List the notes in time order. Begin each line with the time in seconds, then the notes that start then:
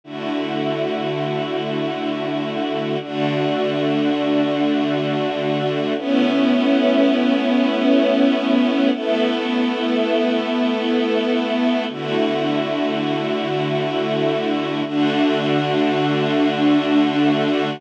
0.04 D3 A3 E4 F#4
3.00 D3 A3 D4 F#4
5.96 A3 B3 C#4 E4
8.92 A3 B3 E4 A4
11.89 D3 A3 E4 F#4
14.85 D3 A3 D4 F#4